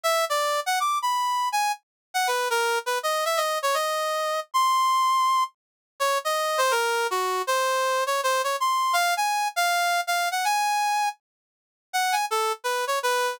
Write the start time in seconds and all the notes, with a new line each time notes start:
0.03 E5
0.30 D5
0.66 F#5
0.80 D6
1.02 B5
1.52 G#5
2.14 F#5
2.27 B4
2.50 A#4
2.86 B4
3.03 D#5
3.25 E5
3.37 D#5
3.62 C#5
3.74 D#5
4.54 C6
6.00 C#5
6.25 D#5
6.58 C5
6.71 A#4
7.11 F#4
7.47 C5
8.07 C#5
8.23 C5
8.44 C#5
8.60 C6
8.93 F5
9.17 G#5
9.56 F5
10.07 F5
10.31 F#5
10.45 G#5
11.93 F#5
12.12 G#5
12.31 A4
12.64 B4
12.87 C#5
13.03 B4